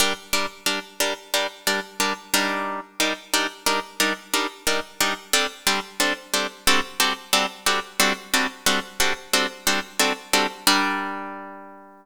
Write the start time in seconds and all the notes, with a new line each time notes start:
0.00 G3 D4 A#4
0.33 G3 D4 A#4
0.66 G3 D4 A#4
1.00 G3 D4 A#4
1.34 G3 D4 A#4
1.67 G3 D4 A#4
2.00 G3 D4 A#4
2.34 G3 D4 D#4 A#4
3.00 G3 D4 D#4 A#4
3.33 G3 D4 D#4 A#4
3.66 G3 D4 D#4 A#4
4.00 G3 D4 D#4 A#4
4.34 G3 D4 D#4 A#4
4.67 G3 D4 D#4 A#4
5.01 G3 D4 D#4 A#4
5.33 G3 C4 D4 A4
5.67 G3 C4 D4 A4
6.00 G3 C4 D4 A4
6.34 G3 C4 D4 A4
6.67 G3 C4 D4 F#4 A4
7.00 G3 C4 D4 F#4 A4
7.33 G3 C4 D4 F#4 A4
7.66 G3 C4 D4 F#4 A4
8.00 G3 C4 D4 F#4 A4
8.34 G3 C4 D4 F#4 A4
8.66 G3 C4 D4 F#4 A4
9.00 G3 C4 D4 F#4 A4
9.33 G3 C4 D4 F#4 A4
9.67 G3 C4 D4 F#4 A4
9.99 G3 C4 D4 F#4 A4
10.33 G3 C4 D4 F#4 A4
10.67 G3 D4 A#4